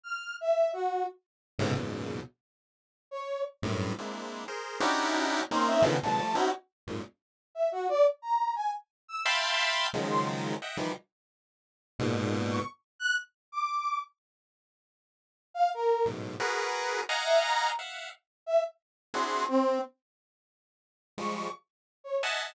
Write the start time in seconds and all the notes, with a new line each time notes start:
0.04 F6
0.41 E5
0.73 F#4
1.59 G#2 A2 B2 C3 C#3
1.75 E2 F#2 G#2 A#2 B2 C#3
3.11 C#5
3.62 F#2 G2 A2
3.98 G#3 A#3 C4 D4 E4
4.48 G#4 A#4 C5
4.80 C#4 D4 D#4 E4 F#4 G4
5.51 A#3 C4 C#4 D#4 C6
5.67 E5
5.82 B2 C#3 D3 D#3 E3 F3
6.03 A#2 C3 D3 E3 F#3 G#3 A5
6.19 F3 G3 A3
6.35 C4 C#4 D#4 E4 F#4
6.87 F2 F#2 G#2 A#2
7.55 E5
7.72 F#4
7.89 D5
8.22 A#5
8.56 G#5
9.08 E6
9.25 E5 F5 G5 A5 B5 C6
9.93 C#3 D#3 F3 F#3 G#3
10.10 C6
10.62 D#5 E5 F#5 G5
10.77 D#3 E3 F3 G3
11.99 G#2 A#2 B2
12.50 C#6
12.99 F#6
13.52 D6
15.54 F5
15.74 A#4
16.05 F#2 G#2 A2 B2
16.40 F#4 G#4 A#4 B4
17.09 D#5 F5 F#5 G#5 A#5
17.24 E5
17.43 A#5
17.79 E5 F5 F#5
18.46 E5
19.14 C4 D4 E4 F#4 G#4 C6
19.48 C4
21.18 F3 G3 G#3 C#6
22.04 C#5
22.23 D#5 E5 F#5 G#5 A5